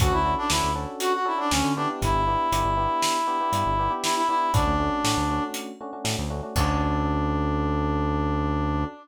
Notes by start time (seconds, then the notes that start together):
0.00 D2 C#4 D4 F#4 A4, kick, closed hi-hat
0.12 D2 E4
0.25 C#4 D4 F#4 A4
0.38 D4
0.50 D2 C#4 D4 E4 F#4 A4, snare
0.63 D2
0.75 C#4 D4 F#4 A4
1.00 F#4, closed hi-hat
1.14 F#4
1.25 C#4 D4 E4 F#4 A4
1.38 C#4 D4 F#4 A4
1.51 D2 C#4 D4 F#4 A4, snare
1.64 D3
1.76 B3 D4 E4 G4
2.02 G1 E4, kick, closed hi-hat
2.14 G1
2.27 B3 D4 E4 G4
2.52 G1 B3 D4 E4 G4, closed hi-hat
2.65 G1
2.77 B3 D4 E4 G4
3.02 snare
3.27 B3 D4 E4 G4
3.41 B3 D4 E4 G4
3.52 G2 B3 D4 E4 G4, closed hi-hat
3.66 G1
3.79 B3 D4 E4 G4
3.90 B3 D4 E4 G4
4.03 E4, snare
4.17 E4
4.29 B3 D4 E4 G4
4.54 D2 A3 C#4 D4 F#4, kick, closed hi-hat
4.67 D2
4.80 A3 C#4 D4 F#4
5.04 A2 A3 C#4 D4 F#4, snare
5.17 D2
5.30 A3 C#4 D4 F#4
5.54 closed hi-hat
5.81 A3 C#4 D4 F#4
5.93 A3 C#4 D4 F#4
6.04 A2 A3 C#4 D4 F#4, snare
6.18 D2
6.30 A3 C#4 D4 F#4
6.43 A3 C#4 D4 F#4
6.55 D2 C#4 D4 F#4 A4, kick, crash